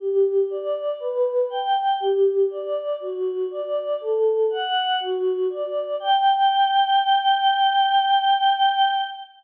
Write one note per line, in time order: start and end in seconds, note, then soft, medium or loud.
0.00 0.46 G4 medium
0.50 0.96 D5 medium
1.00 1.46 B4 medium
1.50 1.96 G5 medium
2.00 2.46 G4 medium
2.50 2.96 D5 medium
3.00 3.46 F#4 medium
3.50 3.96 D5 medium
4.00 4.46 A4 medium
4.50 4.96 F#5 medium
5.00 5.46 F#4 medium
5.50 5.96 D5 medium
6.00 8.93 G5 loud